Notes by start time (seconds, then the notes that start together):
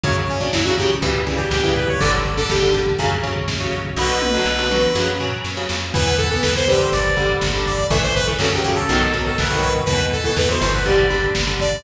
0.04 F#2 C#3 F#3 C#5, kick, closed hi-hat
0.16 kick
0.28 C#4, kick, closed hi-hat
0.39 C#3 F#3 D4, kick
0.53 F#2 E4, kick, snare
0.65 C#3 F#3 F#4, kick
0.78 C#3 F#3 G4, kick, closed hi-hat
0.90 kick
1.02 C#2 C#3 E3 G3, kick, closed hi-hat
1.14 kick
1.27 C#3 E3 G3, kick, closed hi-hat
1.37 G4, kick
1.51 C#2 G4, kick, snare
1.64 C#3 E3 G3, kick
1.76 B4, kick, closed hi-hat
1.88 C#5, kick
2.00 G1 D3 G3 D5, kick, closed hi-hat
2.13 kick
2.25 kick, closed hi-hat
2.37 D3 G3 A4, kick
2.49 G1 G4, kick, snare
2.62 D3 G3, kick
2.74 D3 G3, kick, closed hi-hat
2.86 kick
2.99 F#2 C#3 F#3, kick, closed hi-hat
3.11 kick
3.23 C#3 F#3, kick, closed hi-hat
3.36 kick
3.48 F#2, kick, snare
3.60 C#3 F#3, kick
3.73 kick, closed hi-hat
3.85 kick
3.96 B1 B2 D3 F#3 B4, kick, snare
4.22 high tom
4.34 B2 D3 F#3
4.45 B1
4.59 B2 D3 F#3
4.71 B2 D3 F#3, mid tom
4.95 F#2 C#3 F#3, snare
5.20 C#3 F#3, floor tom
5.44 F#2, snare
5.57 C#3 F#3
5.69 F2, snare
5.94 E2 E3 B3 B4, kick, crash
6.06 kick
6.18 A4, kick, closed hi-hat
6.30 E3 B3 A4, kick
6.42 E2 B4, kick, snare
6.55 E3 B3 C5, kick
6.68 D3 G3 B4, kick, closed hi-hat
6.79 C5, kick
6.92 G1 D5, kick, closed hi-hat
7.05 kick
7.17 D3 G3, kick, closed hi-hat
7.29 kick
7.41 G1, kick, snare
7.54 D3 G3, kick
7.66 D5, kick, closed hi-hat
7.78 kick
7.90 A1 E3 A3 E5, kick, closed hi-hat
8.03 C5, kick
8.15 B4, kick, closed hi-hat
8.27 E3 A3, kick
8.39 F#2 C#3 F#3 A4, kick, snare
8.52 C#3 F#3 G4, kick
8.63 C#3 F#3 G4, kick, closed hi-hat
8.75 A4, kick
8.89 B1 B2 D#3 F#3, kick, closed hi-hat
9.01 kick
9.13 B2 D#3 F#3, kick, closed hi-hat
9.26 A4, kick
9.38 B1 B4, kick, snare
9.50 B2 D#3 F#3, kick
9.62 B4, kick, closed hi-hat
9.75 kick
9.85 E2 B2 E3 B4, kick, closed hi-hat
10.00 kick
10.12 A4, kick, closed hi-hat
10.24 B2 E3 A4, kick
10.36 E2 B4, kick, snare
10.49 B2 E3 C5, kick
10.61 G1 B2 E3 C5, kick, closed hi-hat
10.73 B4, kick
10.86 D3 G3 D5, kick, closed hi-hat
10.98 kick
11.10 D3 G3, kick, closed hi-hat
11.22 kick
11.35 G1, kick, snare
11.47 D3 G3, kick
11.60 D5, kick, closed hi-hat
11.72 kick